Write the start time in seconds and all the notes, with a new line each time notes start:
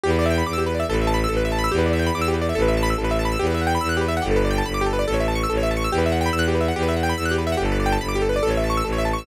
0.03 E2 G4
0.10 B4
0.19 D5
0.26 E5
0.30 G5
0.38 B5
0.46 E2 D6
0.53 E6
0.58 G4
0.66 B4
0.74 D5
0.80 E5
0.88 A1 A4
0.94 B4
1.01 E5
1.07 A5
1.14 B5
1.24 E6
1.29 A1 A4
1.37 B4
1.45 E5
1.52 A5
1.59 B5
1.64 E6
1.72 E2 G4
1.78 B4
1.86 D5
1.93 E5
1.99 G5
2.06 B5
2.14 E2 D6
2.21 E6
2.28 G4
2.34 B4
2.41 D5
2.49 E5
2.55 A1 A4
2.62 B4
2.68 E5
2.77 A5
2.83 B5
2.90 E6
2.98 A1 A4
3.04 B4
3.11 E5
3.19 A5
3.25 B5
3.32 E6
3.39 E2 G4
3.47 B4
3.54 E5
3.61 F#5
3.67 G5
3.75 B5
3.81 E2 E6
3.89 F#6
3.97 G4
4.01 B4
4.08 E5
4.17 F#5
4.22 G1 G4
4.31 A4
4.36 B4
4.45 D5
4.51 G5
4.58 A5
4.66 G1 B5
4.74 D6
4.81 G4
4.86 A4
4.93 B4
4.99 D5
5.07 A1 A4
5.14 C#5
5.20 E5
5.28 A5
5.35 C#6
5.43 E6
5.49 A1 A4
5.57 C#5
5.63 E5
5.71 A5
5.77 C#6
5.84 E6
5.91 E2 G4
5.98 B4
6.06 E5
6.12 F#5
6.21 G5
6.26 B5
6.33 E2 E6
6.39 F#6
6.48 G4
6.55 B4
6.61 E5
6.68 F#5
6.75 E2 G4
6.83 B4
6.89 E5
6.96 F#5
7.03 G5
7.09 B5
7.17 E2 E6
7.25 F#6
7.31 G4
7.38 B4
7.47 E5
7.52 F#5
7.57 G1 G4
7.65 A4
7.72 B4
7.80 D5
7.86 G5
7.92 A5
8.01 G1 B5
8.09 D6
8.15 G4
8.22 A4
8.29 B4
8.36 D5
8.43 A1 A4
8.50 C#5
8.57 E5
8.64 A5
8.70 C#6
8.77 E6
8.84 A1 A4
8.92 C#5
8.98 E5
9.05 A5
9.13 C#6
9.18 E6